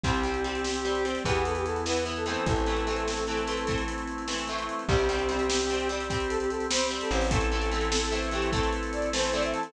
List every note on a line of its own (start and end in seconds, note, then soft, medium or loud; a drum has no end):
0.04 1.16 C2 loud
0.04 0.23 G3 loud
0.04 1.23 C4 medium
0.04 0.23 C4 loud
0.04 1.06 G4 medium
0.04 1.23 G4 medium
0.04 kick medium
0.04 closed hi-hat medium
0.14 closed hi-hat medium
0.24 0.43 G3 medium
0.24 0.43 C4 medium
0.24 closed hi-hat medium
0.34 closed hi-hat medium
0.44 0.81 G3 medium
0.44 0.81 C4 medium
0.44 closed hi-hat medium
0.55 closed hi-hat medium
0.64 snare medium
0.74 closed hi-hat medium
0.85 1.03 G3 medium
0.85 1.03 C4 medium
0.85 closed hi-hat medium
0.95 closed hi-hat medium
1.05 1.24 G3 medium
1.05 1.24 C4 medium
1.05 closed hi-hat medium
1.15 closed hi-hat medium
1.25 2.37 E2 loud
1.25 1.81 E3 loud
1.25 2.45 B3 medium
1.25 1.81 B3 loud
1.25 2.45 E4 medium
1.25 1.44 G4 medium
1.25 kick medium
1.25 closed hi-hat medium
1.35 closed hi-hat medium
1.45 1.55 A4 medium
1.45 closed hi-hat medium
1.55 1.66 G4 medium
1.55 closed hi-hat medium
1.65 1.83 A4 medium
1.65 closed hi-hat medium
1.76 closed hi-hat medium
1.86 2.04 E3 medium
1.86 2.04 B3 medium
1.86 2.05 B4 medium
1.86 snare medium
1.96 closed hi-hat medium
2.05 2.25 E3 loud
2.05 2.25 B3 medium
2.05 closed hi-hat medium
2.16 2.26 A4 medium
2.16 closed hi-hat medium
2.26 2.65 E3 loud
2.26 2.65 A3 loud
2.26 2.65 C4 loud
2.26 2.46 A4 medium
2.26 closed hi-hat medium
2.36 closed hi-hat medium
2.46 4.69 A1 medium
2.46 4.84 A3 medium
2.46 4.84 C4 medium
2.46 4.84 E4 medium
2.46 3.78 A4 medium
2.46 kick medium
2.46 closed hi-hat medium
2.56 closed hi-hat medium
2.66 2.85 E3 medium
2.66 2.85 A3 medium
2.66 2.85 C4 medium
2.66 closed hi-hat medium
2.77 closed hi-hat medium
2.87 3.24 E3 medium
2.87 3.24 A3 medium
2.87 3.24 C4 medium
2.87 closed hi-hat medium
2.96 closed hi-hat medium
3.08 snare medium
3.17 closed hi-hat medium
3.27 3.46 E3 medium
3.27 3.46 A3 medium
3.27 3.46 C4 medium
3.27 closed hi-hat medium
3.37 closed hi-hat medium
3.47 3.66 E3 medium
3.47 3.66 A3 medium
3.47 3.66 C4 medium
3.47 closed hi-hat medium
3.57 closed hi-hat medium
3.67 4.23 E3 medium
3.67 4.23 A3 medium
3.67 4.23 C4 medium
3.67 kick medium
3.67 closed hi-hat medium
3.78 closed hi-hat medium
3.88 closed hi-hat medium
3.98 closed hi-hat medium
4.07 closed hi-hat medium
4.18 closed hi-hat medium
4.28 4.47 E3 medium
4.28 4.47 A3 medium
4.28 4.47 C4 medium
4.28 snare medium
4.38 closed hi-hat medium
4.48 4.86 E3 medium
4.48 4.86 A3 medium
4.48 4.86 C4 medium
4.48 closed hi-hat medium
4.59 closed hi-hat medium
4.69 closed hi-hat medium
4.79 closed hi-hat soft
4.89 7.00 C2 loud
4.89 5.07 G3 loud
4.89 7.26 C4 medium
4.89 5.07 C4 loud
4.89 7.26 G4 medium
4.89 5.88 G4 medium
4.89 kick medium
4.89 crash medium
4.99 closed hi-hat medium
5.09 5.28 G3 loud
5.09 5.28 C4 loud
5.09 closed hi-hat medium
5.19 closed hi-hat medium
5.29 5.66 G3 loud
5.29 5.66 C4 loud
5.29 closed hi-hat medium
5.39 closed hi-hat medium
5.49 snare loud
5.60 closed hi-hat medium
5.70 5.89 G3 loud
5.70 5.89 C4 medium
5.70 closed hi-hat medium
5.80 closed hi-hat medium
5.89 6.08 G3 loud
5.89 6.08 C4 loud
5.89 closed hi-hat medium
6.00 closed hi-hat medium
6.09 6.66 G3 loud
6.09 6.66 C4 loud
6.09 6.28 G4 medium
6.09 kick medium
6.09 closed hi-hat medium
6.20 closed hi-hat medium
6.29 6.39 A4 medium
6.29 closed hi-hat medium
6.40 6.50 G4 medium
6.40 closed hi-hat medium
6.50 6.67 A4 medium
6.50 closed hi-hat medium
6.60 closed hi-hat medium
6.70 6.89 G3 loud
6.70 6.89 C4 medium
6.70 6.87 C5 medium
6.70 snare loud
6.81 closed hi-hat medium
6.91 7.28 G3 loud
6.91 7.28 C4 loud
6.91 closed hi-hat medium
7.01 7.11 A4 medium
7.01 closed hi-hat medium
7.10 9.54 A1 loud
7.10 7.28 C5 medium
7.10 closed hi-hat medium
7.21 open hi-hat medium
7.31 7.50 E3 loud
7.31 7.50 A3 loud
7.31 9.68 C4 medium
7.31 7.50 C4 loud
7.31 9.68 E4 medium
7.31 9.68 A4 medium
7.31 8.15 A4 medium
7.31 kick medium
7.31 closed hi-hat loud
7.41 closed hi-hat medium
7.52 7.70 E3 loud
7.52 7.70 A3 loud
7.52 7.70 C4 loud
7.52 closed hi-hat medium
7.62 closed hi-hat medium
7.71 8.09 E3 loud
7.71 8.09 A3 loud
7.71 8.09 C4 loud
7.71 closed hi-hat medium
7.81 closed hi-hat medium
7.92 snare loud
8.01 closed hi-hat medium
8.12 8.30 E3 loud
8.12 8.30 A3 medium
8.12 8.30 C4 loud
8.12 closed hi-hat medium
8.23 closed hi-hat medium
8.31 8.51 E3 medium
8.31 8.51 A3 loud
8.31 8.51 C4 loud
8.31 8.51 G4 medium
8.31 closed hi-hat medium
8.42 closed hi-hat medium
8.52 9.08 E3 loud
8.52 9.08 A3 loud
8.52 9.08 C4 medium
8.52 8.70 A4 medium
8.52 kick medium
8.52 closed hi-hat medium
8.63 closed hi-hat medium
8.73 closed hi-hat medium
8.83 closed hi-hat medium
8.92 9.09 D5 medium
8.92 closed hi-hat medium
9.02 closed hi-hat medium
9.13 9.32 E3 medium
9.13 9.32 A3 loud
9.13 9.32 C4 loud
9.13 9.23 C5 medium
9.13 snare loud
9.23 9.33 C5 medium
9.23 closed hi-hat medium
9.33 9.71 E3 loud
9.33 9.71 A3 loud
9.33 9.71 C4 loud
9.33 9.43 D5 medium
9.33 closed hi-hat medium
9.43 9.54 E5 medium
9.43 closed hi-hat medium
9.54 9.64 A5 medium
9.54 closed hi-hat medium
9.63 9.72 A4 medium
9.63 closed hi-hat medium